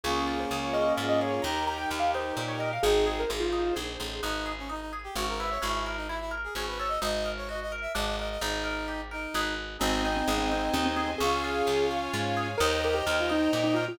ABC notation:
X:1
M:3/4
L:1/16
Q:1/4=129
K:Ab
V:1 name="Acoustic Grand Piano"
A2 A c z d e2 e e d d | b2 b g z f c2 c d e f | A2 A B A F3 z4 | [K:G#m] z12 |
z12 | z12 | z12 | [K:Ab] C2 C C z C C2 C C C C |
A6 z6 | B2 B G z F E2 E E F F |]
V:2 name="Brass Section"
[B,D]12 | [EG]12 | [CE]4 z8 | [K:G#m] D3 C D D z =G F A B c |
E3 D E E z G G B c d | d3 c d d z e d d d d | D6 D4 z2 | [K:Ab] [CE]12 |
[DF]12 | [ce]12 |]
V:3 name="Orchestral Harp"
D2 F2 A2 D2 F2 A2 | E2 G2 B2 E2 G2 B2 | E2 A2 c2 E2 A2 c2 | [K:G#m] B,2 G2 D2 G2 C2 E2 |
C2 A2 E2 A2 C2 =A2 | D2 A2 F2 A2 =D2 A2 | D2 A2 =G2 A2 [D^GB]4 | [K:Ab] C2 E2 A2 C2 E2 A2 |
D2 F2 A2 D2 F2 A2 | E2 G2 B2 E2 G2 B2 |]
V:4 name="Electric Bass (finger)" clef=bass
D,,4 D,,4 A,,4 | E,,4 E,,4 B,,4 | A,,,4 A,,,4 B,,,2 =A,,,2 | [K:G#m] G,,,8 G,,,4 |
G,,,8 G,,,4 | G,,,8 G,,,4 | G,,,8 G,,,4 | [K:Ab] A,,,4 A,,,4 E,,4 |
D,,4 D,,4 A,,4 | E,,4 E,,4 B,,4 |]
V:5 name="String Ensemble 1"
[DFA]12 | [EGB]12 | [EAc]12 | [K:G#m] z12 |
z12 | z12 | z12 | [K:Ab] [cea]12 |
[dfa]12 | [egb]12 |]